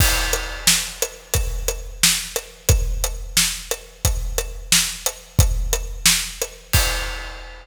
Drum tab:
CC |x-----------|------------|------------|------------|
HH |---x-----x--|x--x-----x--|x--x-----x--|x--x-----x--|
SD |------o-----|------o-----|------o-----|------o-----|
BD |o-----------|o-----------|o-----------|o-----------|

CC |------------|x-----------|
HH |x--x-----x--|------------|
SD |------o-----|------------|
BD |o-----------|o-----------|